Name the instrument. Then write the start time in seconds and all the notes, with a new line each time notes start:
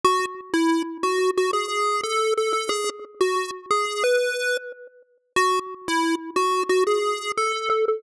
lead 1 (square)
0.04 F#4
0.53 E4
1.03 F#4
1.37 F#4
1.53 G#4
2.03 A4
2.37 A4
2.53 A4
2.69 G#4
3.21 F#4
3.71 G#4
4.04 B4
5.36 F#4
5.88 E4
6.36 F#4
6.69 F#4
6.87 G#4
7.37 A4
7.70 A4
7.88 A4